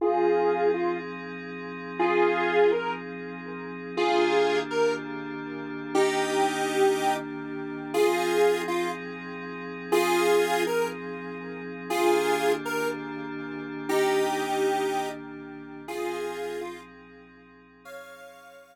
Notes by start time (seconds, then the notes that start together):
0.01 F3 C4 D#4 F4 G#4
0.74 F4
1.99 F4 G#4
2.72 A#4
3.97 D#3 A#3 D4 F4 G4 G#4
4.71 A#4
5.95 D#4 G4
7.94 F3 C4 D#4 F4 G#4
8.68 F4
9.92 F4 G#4
10.67 A#4
11.89 D#3 A#3 D4 F4 G4 G#4
12.65 A#4
13.89 D#4 G4
15.87 F3 C4 D#4 F4 G#4
16.61 F4
17.85 C#5 F5